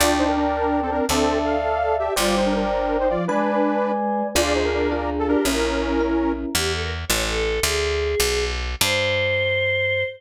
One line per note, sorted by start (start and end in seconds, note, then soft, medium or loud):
0.00 1.01 D2 medium
0.00 0.45 D4 medium
0.00 0.15 F4 medium
0.00 0.15 D5 medium
0.00 0.97 D5 medium
0.00 0.97 G5 loud
0.00 0.97 A5 medium
0.18 0.27 D#4 medium
0.18 0.27 C5 medium
0.28 0.36 D4 medium
0.28 0.36 A#4 medium
0.37 0.81 D4 medium
0.37 0.81 A#4 medium
0.82 0.91 C4 medium
0.82 0.91 A4 medium
0.91 1.06 C4 medium
0.91 1.06 D4 medium
0.91 1.06 A#4 medium
1.09 2.09 D2 medium
1.09 1.39 C4 medium
1.09 1.56 D4 medium
1.09 1.39 A4 loud
1.09 2.09 D5 medium
1.09 2.09 E5 loud
1.09 2.09 A5 medium
1.44 1.96 A4 medium
1.44 1.96 F5 medium
1.99 2.14 G4 medium
1.99 2.14 E5 medium
2.16 3.17 G1 medium
2.16 2.65 G3 loud
2.16 2.36 F4 medium
2.16 3.14 C5 medium
2.16 3.14 D5 loud
2.16 2.36 D5 medium
2.16 3.14 G5 medium
2.37 2.45 D#4 medium
2.37 2.45 C5 medium
2.46 2.54 D4 medium
2.46 2.54 A#4 medium
2.55 2.97 D4 medium
2.55 2.97 A#4 medium
3.00 3.09 D#4 medium
3.00 3.09 C5 medium
3.09 3.27 F3 medium
3.09 3.25 F4 medium
3.09 3.25 D5 medium
3.27 4.23 G#3 loud
3.27 3.92 D4 medium
3.27 3.92 B4 medium
3.27 4.27 B4 loud
3.27 4.27 D5 loud
3.27 4.27 G#5 medium
4.35 5.36 D2 medium
4.35 4.84 D4 medium
4.35 4.84 F4 loud
4.35 4.53 F4 medium
4.35 4.84 G#4 loud
4.35 4.88 G#4 medium
4.35 4.53 D5 medium
4.55 4.64 D#4 medium
4.55 4.64 C5 medium
4.64 4.73 D4 medium
4.64 4.73 A#4 medium
4.73 5.10 D4 medium
4.73 5.10 A#4 medium
4.92 5.41 D4 medium
4.92 5.41 F4 medium
4.92 5.41 G#4 medium
5.19 5.28 A4 medium
5.27 5.46 D4 medium
5.27 5.44 G4 medium
5.27 5.45 A#4 medium
5.45 6.45 A#1 medium
5.45 5.94 C#4 loud
5.45 6.32 C#4 medium
5.45 5.94 E4 loud
5.45 6.29 E4 medium
5.45 5.94 A#4 medium
5.45 6.32 A#4 medium
6.00 6.49 C#4 medium
6.00 6.49 E4 medium
6.00 6.49 A#4 medium
6.55 7.05 E2 medium
6.55 6.72 G4 medium
6.73 6.81 A4 medium
6.82 6.90 A#4 medium
7.08 7.60 A1 medium
7.08 7.23 C#5 medium
7.27 7.59 A4 medium
7.63 8.15 D2 medium
7.63 8.44 G#4 medium
8.20 8.75 B1 loud
8.81 10.04 G2 loud
8.81 10.04 C5 loud